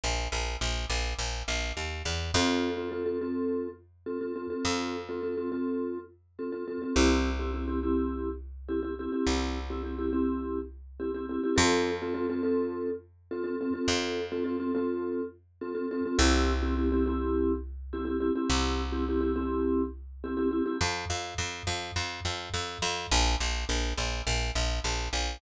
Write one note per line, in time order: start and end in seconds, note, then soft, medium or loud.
0.04 0.28 A#1 medium
0.32 0.57 A#1 medium
0.61 0.86 A#1 medium
0.90 1.14 A#1 medium
1.19 1.43 A#1 medium
1.48 1.72 A#1 medium
1.77 2.03 D#2 medium
2.05 2.31 E2 medium
2.34 4.47 F2 loud
2.34 2.70 C4 loud
2.34 2.70 F4 loud
2.34 2.70 A4 loud
2.77 2.88 C4 medium
2.77 2.88 F4 medium
2.77 2.88 A4 medium
2.92 3.03 C4 medium
2.92 3.03 F4 medium
2.92 3.03 A4 medium
3.06 3.17 C4 medium
3.06 3.17 F4 medium
3.06 3.17 A4 medium
3.21 3.67 C4 medium
3.21 3.67 F4 medium
3.21 3.67 A4 loud
4.06 4.18 C4 medium
4.06 4.18 F4 medium
4.06 4.18 A4 medium
4.21 4.32 C4 medium
4.21 4.32 F4 medium
4.21 4.32 A4 medium
4.36 4.47 C4 medium
4.36 4.47 F4 medium
4.36 4.47 A4 medium
4.50 4.96 C4 medium
4.50 4.96 F4 medium
4.50 4.96 A4 medium
4.65 6.77 F2 medium
5.09 5.20 C4 medium
5.09 5.20 F4 medium
5.09 5.20 A4 medium
5.23 5.35 C4 medium
5.23 5.35 F4 medium
5.23 5.35 A4 medium
5.37 5.49 C4 medium
5.37 5.49 F4 medium
5.37 5.49 A4 medium
5.52 5.98 C4 medium
5.52 5.98 F4 loud
5.52 5.98 A4 medium
6.39 6.50 C4 medium
6.39 6.50 F4 medium
6.39 6.50 A4 medium
6.52 6.64 C4 medium
6.52 6.64 F4 medium
6.52 6.64 A4 medium
6.68 6.79 C4 medium
6.68 6.79 F4 medium
6.68 6.79 A4 medium
6.82 6.93 C4 medium
6.82 6.93 F4 medium
6.82 6.93 A4 medium
6.96 9.08 C2 loud
6.96 7.30 C4 loud
6.96 7.30 E4 loud
6.96 7.30 G4 loud
7.39 7.51 C4 medium
7.39 7.51 E4 medium
7.39 7.51 G4 medium
7.54 7.65 C4 medium
7.54 7.65 E4 medium
7.54 7.65 G4 medium
7.68 7.79 C4 medium
7.68 7.79 E4 medium
7.68 7.79 G4 medium
7.83 8.29 C4 loud
7.83 8.29 E4 loud
7.83 8.29 G4 medium
8.69 8.80 C4 medium
8.69 8.80 E4 medium
8.69 8.80 G4 medium
8.83 8.94 C4 medium
8.83 8.94 E4 medium
8.83 8.94 G4 medium
8.99 9.11 C4 medium
8.99 9.11 E4 medium
8.99 9.11 G4 medium
9.12 9.59 C4 medium
9.12 9.59 E4 medium
9.12 9.59 G4 medium
9.27 11.39 C2 medium
9.70 9.82 C4 medium
9.70 9.82 E4 medium
9.70 9.82 G4 medium
9.83 9.95 C4 medium
9.83 9.95 E4 medium
9.83 9.95 G4 medium
9.99 10.10 C4 medium
9.99 10.10 E4 medium
9.99 10.10 G4 medium
10.13 10.59 C4 loud
10.13 10.59 E4 medium
10.13 10.59 G4 medium
11.00 11.11 C4 medium
11.00 11.11 E4 medium
11.00 11.11 G4 medium
11.14 11.26 C4 medium
11.14 11.26 E4 medium
11.14 11.26 G4 medium
11.29 11.41 C4 medium
11.29 11.41 E4 medium
11.29 11.41 G4 medium
11.44 11.55 C4 medium
11.44 11.55 E4 medium
11.44 11.55 G4 loud
11.56 13.70 F2 loud
11.56 11.91 C4 loud
11.56 11.91 F4 loud
11.56 11.91 A4 loud
12.02 12.13 C4 loud
12.02 12.13 F4 loud
12.02 12.13 A4 medium
12.14 12.26 C4 loud
12.14 12.26 F4 loud
12.14 12.26 A4 loud
12.30 12.41 C4 loud
12.30 12.41 F4 loud
12.30 12.41 A4 loud
12.43 12.89 C4 loud
12.43 12.89 F4 medium
12.43 12.89 A4 loud
13.31 13.43 C4 medium
13.31 13.43 F4 loud
13.31 13.43 A4 loud
13.44 13.56 C4 loud
13.44 13.56 F4 loud
13.44 13.56 A4 loud
13.61 13.72 C4 loud
13.61 13.72 F4 medium
13.61 13.72 A4 medium
13.74 14.20 C4 loud
13.74 14.20 F4 medium
13.74 14.20 A4 loud
13.88 16.00 F2 loud
14.32 14.43 C4 loud
14.32 14.43 F4 loud
14.32 14.43 A4 medium
14.44 14.56 C4 loud
14.44 14.56 F4 medium
14.44 14.56 A4 loud
14.60 14.71 C4 loud
14.60 14.71 F4 loud
14.60 14.71 A4 medium
14.75 15.21 C4 loud
14.75 15.21 F4 loud
14.75 15.21 A4 medium
15.61 15.73 C4 loud
15.61 15.73 F4 medium
15.61 15.73 A4 medium
15.75 15.86 C4 loud
15.75 15.86 F4 medium
15.75 15.86 A4 medium
15.91 16.03 C4 loud
15.91 16.03 F4 medium
15.91 16.03 A4 loud
16.05 16.17 C4 loud
16.05 16.17 F4 loud
16.05 16.17 A4 medium
16.18 18.31 C2 loud
16.18 16.53 C4 loud
16.18 16.53 E4 loud
16.18 16.53 G4 loud
16.62 16.74 C4 loud
16.62 16.74 E4 loud
16.62 16.74 G4 loud
16.77 16.89 C4 loud
16.77 16.89 E4 loud
16.77 16.89 G4 medium
16.92 17.04 C4 loud
16.92 17.04 E4 medium
16.92 17.04 G4 loud
17.06 17.52 C4 loud
17.06 17.52 E4 loud
17.06 17.52 G4 loud
17.93 18.04 C4 loud
17.93 18.04 E4 loud
17.93 18.04 G4 loud
18.05 18.17 C4 medium
18.05 18.17 E4 loud
18.05 18.17 G4 loud
18.20 18.32 C4 medium
18.20 18.32 E4 loud
18.20 18.32 G4 loud
18.36 18.82 C4 loud
18.36 18.82 E4 loud
18.36 18.82 G4 medium
18.50 20.62 C2 loud
18.92 19.04 C4 loud
18.92 19.04 E4 loud
18.92 19.04 G4 loud
19.09 19.20 C4 medium
19.09 19.20 E4 medium
19.09 19.20 G4 loud
19.21 19.32 C4 medium
19.21 19.32 E4 loud
19.21 19.32 G4 loud
19.36 19.82 C4 loud
19.36 19.82 E4 loud
19.36 19.82 G4 loud
20.24 20.35 C4 loud
20.24 20.35 E4 medium
20.24 20.35 G4 loud
20.37 20.49 C4 loud
20.37 20.49 E4 loud
20.37 20.49 G4 loud
20.51 20.63 C4 loud
20.51 20.63 E4 loud
20.51 20.63 G4 medium
20.66 20.77 C4 medium
20.66 20.77 E4 loud
20.66 20.77 G4 loud
20.81 21.05 F2 loud
21.10 21.34 F2 medium
21.38 21.63 F2 medium
21.67 21.91 F2 medium
21.96 22.20 F2 medium
22.25 22.49 F2 medium
22.54 22.78 F2 medium
22.82 23.07 F2 loud
23.11 23.36 A#1 loud
23.40 23.65 A#1 medium
23.69 23.93 A#1 medium
23.97 24.22 A#1 medium
24.27 24.51 A#1 medium
24.55 24.80 A#1 medium
24.84 25.09 A#1 medium
25.13 25.37 A#1 medium